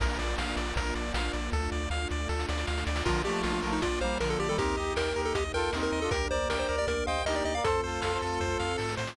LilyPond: <<
  \new Staff \with { instrumentName = "Lead 1 (square)" } { \time 4/4 \key bes \major \tempo 4 = 157 r1 | r1 | f'8 g'8 f'16 f'8 ees'16 f'8 c''8 bes'16 a'16 g'16 a'16 | g'4 bes'8. a'16 g'16 r16 bes'8. bes'8 a'16 |
bes'8 c''8 bes'16 c''8 d''16 bes'8 f''8 ees''16 d''16 ees''16 f''16 | a'1 | }
  \new Staff \with { instrumentName = "Brass Section" } { \time 4/4 \key bes \major r1 | r1 | <d f>8 <f a>4 <f a>8 r8 <g bes>8 <d f>8. <ees g>16 | <c' ees'>8 <ees' g'>4 <ees' g'>8 r8 <f' a'>8 <c' ees'>8. <d' f'>16 |
<g' bes'>8 <bes' d''>4 <bes' d''>8 r8 <c'' ees''>8 <ees' g'>8. <bes' d''>16 | <a' c''>8 <f' a'>8 <f' a'>16 <a' c''>16 <f' a'>4. r4 | }
  \new Staff \with { instrumentName = "Lead 1 (square)" } { \time 4/4 \key bes \major bes'8 d''8 f''8 d''8 bes'8 d''8 f''8 d''8 | a'8 d''8 f''8 d''8 a'8 d''8 f''8 d''8 | bes'8 d''8 f''8 bes'8 d''8 f''8 bes'8 d''8 | bes'8 ees''8 g''8 bes'8 ees''8 g''8 bes'8 ees''8 |
bes'8 d''8 g''8 bes'8 d''8 g''8 bes'8 d''8 | a'8 c''8 f''8 a'8 c''8 f''8 a'8 c''8 | }
  \new Staff \with { instrumentName = "Synth Bass 1" } { \clef bass \time 4/4 \key bes \major bes,,8 bes,,8 bes,,8 bes,,8 bes,,8 bes,,8 bes,,8 bes,,8 | d,8 d,8 d,8 d,8 d,8 d,8 d,8 d,8 | bes,,8 bes,,8 bes,,8 bes,,8 bes,,8 bes,,8 bes,,8 bes,,8 | ees,8 ees,8 ees,8 ees,8 ees,8 ees,8 ees,8 ees,8 |
d,8 d,8 d,8 d,8 d,8 d,8 d,8 d,8 | f,8 f,8 f,8 f,8 f,8 f,8 aes,8 a,8 | }
  \new Staff \with { instrumentName = "String Ensemble 1" } { \time 4/4 \key bes \major <bes d' f'>1 | <a d' f'>1 | <bes d' f'>1 | <bes ees' g'>1 |
<bes d' g'>1 | <a c' f'>1 | }
  \new DrumStaff \with { instrumentName = "Drums" } \drummode { \time 4/4 <cymc bd>8 hh8 sn8 hh8 <hh bd>8 hh8 sn8 hh8 | <bd sn>8 sn8 sn8 sn8 sn16 sn16 sn16 sn16 sn16 sn16 sn16 sn16 | <cymc bd>4 sn4 <hh bd>4 sn4 | <hh bd>4 sn4 <hh bd>4 sn4 |
<hh bd>4 sn4 <hh bd>4 sn4 | <hh bd>4 sn4 <bd sn>8 sn8 sn16 sn16 sn16 sn16 | }
>>